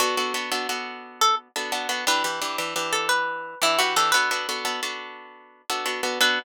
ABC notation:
X:1
M:12/8
L:1/8
Q:3/8=116
K:Bm
V:1 name="Acoustic Guitar (steel)"
F5 z2 A z4 | B5 A B3 E F A | B5 z7 | B3 z9 |]
V:2 name="Acoustic Guitar (steel)"
[B,DA] [B,DFA] [B,DFA] [B,DFA] [B,DFA]5 [B,DFA] [B,DFA] [B,DFA] | [E,DG] [E,DGB] [E,DGB] [E,DGB] [E,DGB]5 [E,DGB] [E,DGB] [E,DGB] | [B,DFA] [B,DFA] [B,DFA] [B,DFA] [B,DFA]5 [B,DFA] [B,DFA] [B,DFA] | [B,DFA]3 z9 |]